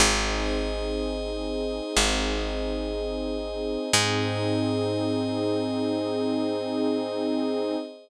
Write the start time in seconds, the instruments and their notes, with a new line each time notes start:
0.00 electric bass (finger) G#1, pad 2 (warm) C4 D#4 G#4, pad 5 (bowed) G#4 C5 D#5
1.97 electric bass (finger) G#1
3.93 electric bass (finger) G#2, pad 2 (warm) C4 D#4 G#4, pad 5 (bowed) G#4 C5 D#5